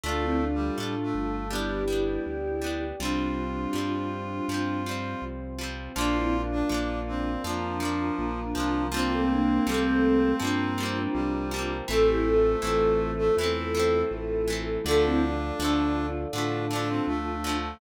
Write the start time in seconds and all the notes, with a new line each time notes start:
0.04 D2 A3 D4 F4 A4 D5 F5
0.08 F4
0.23 C4 E4
0.41 D4 F4
0.54 G3
0.78 A2 A3 D4 F4 A4 F5 A5
0.83 F4
1.03 A3
1.15 G1
1.50 G3 B3 D4 E4 G4 B4 D5
1.55 D4
1.88 G3 B3
1.93 D4
2.26 D2 G4 D5 G5
2.62 G3 B3
2.67 D4
3.00 C2 F3 G3 C4 D4 F4 G4 C5
3.05 C4
3.73 G2 F3 G3
3.78 C4
4.48 G2 F3 G3 C4 F4 C5
4.54 C4
4.86 F3 G3
4.91 C4
5.22 C2
5.59 F3 G3
5.64 C4
5.95 A#1 F3 A#3 D4 F4 A#4 D5 F5
6.01 D4
6.15 C4 E4
6.33 D4 F4
6.52 D4
6.69 A#1 F3 A#3 D4 F4
6.74 D4
7.08 C4
7.44 F2 F3 A#3 D4 F4 A#4 F5 A#5
7.49 D4
7.80 F3 A#3
7.85 D4
8.19 A#1 F3 A#3 D4
8.55 C2 F3 A#3
8.60 D4
8.92 F3 G3 A#3 C4 D4 F4 A#4 C5 F5 G5
8.97 A#3 C4
9.11 A3 C4
9.30 A#3 D4
9.67 C2 F3 G3 A3 A#3 C4
9.72 A#3 C4
10.40 G2 F3 G3 A#3 C4 D4 F4 A#4 C5 G5 A#5
10.44 A#3 C4
10.78 F3 G3
10.83 A#3 C4
11.14 C2 F3 G3 A#3 C4
11.51 F3 G3
11.56 A#3 C4
11.88 A1 E3 A3 C4 F4 A4 C5 E5
11.93 C4
12.07 E4 G4
12.25 F4 A4
12.62 A1 E3 A3 C4 F4 A4
12.67 C4
13.19 A3
13.36 E2 E3 A3 C4 E4 F4 A4 E5
13.41 A3 C4
13.75 E3 A3
13.79 C4
14.11 A1 E3 A3 C4
14.48 E3 A3
14.53 C4
14.84 D2 D3 F3 A3 D4 F4 A4 D5 F5
14.91 A3
15.04 C4 E4
15.22 D4 F4
15.59 D2 D3 F3 A3 D4 F4
15.65 A3
16.33 A2 D3 F3 A3 D4 F4 A4 F5 A5
16.38 A3
16.71 D3 F3 D4
16.75 A3
16.89 C4
17.07 D2 D3 F3 A3
17.44 D3 F3
17.49 A3